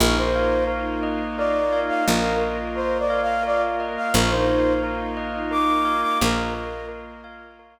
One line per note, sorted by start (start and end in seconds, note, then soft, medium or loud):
0.00 1.91 A#1 loud
0.00 2.04 A#3 loud
0.00 2.04 D#4 medium
0.00 2.04 F4 loud
0.00 0.16 A#4 loud
0.00 0.67 A#4 medium
0.18 0.64 C5 loud
0.35 1.72 F5 medium
0.67 1.38 A#4 medium
1.03 2.06 D#5 medium
1.37 2.41 A#4 medium
1.37 1.80 D5 medium
1.72 3.09 F5 medium
1.89 2.05 F5 medium
2.06 3.98 A#1 loud
2.06 4.11 A#3 medium
2.06 4.11 F4 loud
2.06 4.11 A#4 loud
2.06 2.36 A#4 loud
2.06 3.79 D#5 medium
2.41 2.75 A#4 medium
2.75 3.43 A#4 medium
2.75 2.98 C5 medium
2.99 3.21 D5 medium
3.10 4.08 F5 medium
3.22 3.44 F5 loud
3.43 4.09 A#4 medium
3.43 3.62 D5 loud
3.80 4.13 D#5 medium
3.97 4.13 F5 medium
4.14 6.04 A#1 loud
4.14 6.19 A#3 medium
4.14 6.19 D#4 loud
4.14 6.19 F4 loud
4.14 4.31 A#4 loud
4.14 4.83 A#4 loud
4.30 4.73 C5 loud
4.48 5.84 F5 medium
4.83 5.51 A#4 medium
5.17 6.21 D#5 medium
5.51 6.54 A#4 medium
5.51 6.01 D6 medium
5.85 7.23 F5 medium
6.02 6.18 D6 medium
6.21 7.79 A#1 medium
6.21 7.79 A#3 medium
6.21 7.79 F4 loud
6.21 7.79 A#4 medium
6.21 6.86 A#4 loud
6.21 7.79 D#5 medium
6.54 6.88 A#4 medium
6.89 7.59 A#4 medium
7.24 7.79 F5 medium
7.59 7.79 A#4 medium